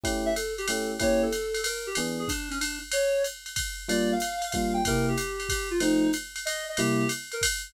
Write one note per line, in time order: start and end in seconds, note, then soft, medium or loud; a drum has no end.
0.03 0.29 A3 medium
0.03 0.29 C#4 medium
0.03 0.29 E4 medium
0.03 0.29 G4 medium
0.03 kick medium
0.03 ride medium
0.26 0.34 E5 loud
0.36 0.54 A4 medium
0.36 hi-hat pedal medium
0.36 ride medium
0.58 0.67 G4 loud
0.58 ride medium
0.68 0.94 A3 medium
0.68 0.94 C#4 medium
0.68 0.94 E4 medium
0.68 0.94 G4 medium
0.68 0.90 A4 medium
0.68 ride loud
1.00 1.26 A#3 medium
1.00 1.26 C#4 medium
1.00 1.26 E4 medium
1.00 1.26 G4 medium
1.00 1.22 C#5 loud
1.00 kick medium
1.00 ride medium
1.23 1.61 A4 loud
1.32 hi-hat pedal medium
1.32 ride medium
1.54 ride medium
1.64 1.86 A#4 medium
1.64 ride loud
1.87 1.95 G4 medium
1.95 2.23 E3 medium
1.95 2.23 B3 medium
1.95 2.23 D4 medium
1.95 2.23 G#4 medium
1.95 ride medium
2.19 2.28 G#4 loud
2.28 2.49 D4 loud
2.28 kick medium
2.28 hi-hat pedal medium
2.28 ride medium
2.51 2.59 C#4 medium
2.51 ride medium
2.61 2.79 D4 medium
2.61 ride medium
2.92 3.23 C#5 loud
2.92 ride loud
3.24 hi-hat pedal medium
3.24 ride medium
3.46 ride medium
3.56 kick medium
3.56 ride loud
3.88 4.14 G3 medium
3.88 4.14 A#3 medium
3.88 4.14 D4 medium
3.88 4.14 F4 medium
3.88 4.10 D5 loud
3.88 ride medium
4.12 4.50 F5 loud
4.20 hi-hat pedal medium
4.20 ride medium
4.42 ride medium
4.52 4.80 G3 medium
4.52 4.80 A#3 medium
4.52 4.80 D4 medium
4.52 4.80 F4 medium
4.52 4.73 F5 medium
4.52 kick medium
4.52 ride medium
4.74 4.83 G5 medium
4.85 5.13 C3 medium
4.85 5.13 A#3 medium
4.85 5.13 E4 medium
4.85 5.13 G4 medium
4.85 5.06 A#4 loud
4.85 kick medium
4.85 ride medium
5.08 5.48 G4 medium
5.17 hi-hat pedal medium
5.17 ride medium
5.40 ride medium
5.49 5.69 G4 medium
5.49 kick medium
5.49 ride medium
5.71 5.79 F4 medium
5.80 6.06 F3 loud
5.80 6.06 A3 medium
5.80 6.06 C4 medium
5.80 6.06 D#4 medium
5.80 6.11 D#4 loud
5.80 ride medium
6.13 hi-hat pedal medium
6.13 ride medium
6.36 ride medium
6.45 6.64 D#5 loud
6.45 ride medium
6.69 6.78 D#5 medium
6.77 7.04 C3 medium
6.77 7.04 G3 medium
6.77 7.04 A#3 loud
6.77 7.04 E4 medium
6.77 7.08 G4 loud
6.77 ride medium
7.09 hi-hat pedal medium
7.09 ride medium
7.32 7.42 A#4 loud
7.32 ride medium
7.41 kick medium
7.41 ride loud